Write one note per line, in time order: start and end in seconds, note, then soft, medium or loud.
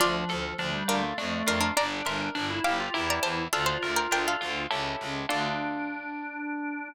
0.00 0.25 D2 loud
0.00 0.55 F3 medium
0.00 0.59 D4 loud
0.00 0.81 F4 loud
0.00 0.81 D5 loud
0.29 0.54 D2 medium
0.29 1.13 A4 medium
0.58 0.83 D2 medium
0.58 0.73 F3 medium
0.58 1.15 D4 medium
0.73 0.87 G3 medium
0.88 1.13 D2 medium
0.88 1.02 G3 medium
0.88 1.14 D4 medium
0.88 1.16 F4 medium
0.88 1.14 A#4 loud
1.03 1.17 A3 medium
1.18 1.43 F2 loud
1.18 1.70 A3 medium
1.18 1.74 D4 medium
1.46 1.71 F2 medium
1.46 1.60 D4 medium
1.46 1.75 F4 medium
1.46 1.60 A#4 loud
1.61 1.75 D4 medium
1.61 1.75 A#4 medium
1.76 2.02 G1 loud
1.76 2.29 D4 loud
1.76 2.34 D4 loud
1.76 2.01 D5 loud
1.76 2.01 A#5 loud
2.05 2.30 G1 medium
2.05 2.90 A#4 medium
2.05 2.60 E5 medium
2.05 2.60 C6 medium
2.35 2.60 G1 medium
2.35 2.49 D4 loud
2.35 2.91 D4 medium
2.50 2.64 E4 medium
2.64 2.89 G1 medium
2.64 2.78 E4 medium
2.64 2.93 G4 medium
2.64 2.90 F5 medium
2.64 2.90 D6 loud
2.80 2.94 F4 loud
2.94 3.19 E2 loud
2.94 3.47 E4 loud
2.94 3.43 E4 medium
2.94 3.47 G4 loud
2.94 3.47 A#4 loud
3.10 3.24 D5 medium
3.10 3.24 A#5 medium
3.23 3.48 E2 medium
3.23 3.47 C5 medium
3.23 3.47 A5 loud
3.53 3.78 D2 medium
3.53 4.11 D4 medium
3.53 4.64 F4 medium
3.53 3.67 A4 loud
3.53 3.67 F5 loud
3.66 3.90 C5 medium
3.66 3.90 A5 medium
3.82 4.07 D2 medium
3.82 4.66 A#4 medium
3.96 4.10 A#4 medium
3.96 4.10 G5 loud
4.11 4.36 D2 medium
4.11 4.68 D4 medium
4.11 4.26 A#4 medium
4.11 4.26 G5 loud
4.28 4.98 A4 medium
4.28 4.98 F5 medium
4.41 4.67 D2 medium
4.41 4.69 F4 medium
4.71 4.96 C#2 loud
4.71 5.24 C#4 medium
4.71 5.24 E4 loud
4.71 5.24 G4 loud
4.71 5.24 A4 loud
5.01 5.26 C#2 medium
5.29 6.90 D2 loud
5.29 6.88 D4 loud
5.29 6.89 D4 loud
5.29 6.88 F4 loud
5.29 6.88 A4 loud
5.29 6.90 D5 loud